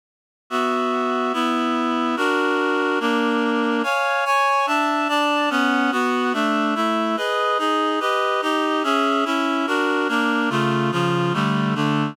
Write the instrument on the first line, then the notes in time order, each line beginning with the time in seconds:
clarinet
0.50 B3 F#4 E5
1.33 B3 E4 E5
2.16 D4 F#4 A#4
3.00 A#3 D4 A#4
3.83 C#5 F5 G#5
4.25 C#5 G#5 C#6
4.66 D4 E5 A5
5.08 D4 D5 A5
5.50 B3 C#4 F#5
5.92 B3 F#4 F#5
6.33 A3 D4 E5
6.75 A3 E4 E5
7.17 G#4 B4 D#5
7.58 D#4 G#4 D#5
8.00 G4 B4 D#5
8.42 D#4 G4 D#5
8.83 C#4 G#4 E5
9.25 C#4 E4 E5
9.67 D4 F#4 A#4
10.08 A#3 D4 A#4
10.50 C#3 A3 F4
10.92 C#3 F3 F4
11.33 D3 G3 A3
11.75 D3 A3 D4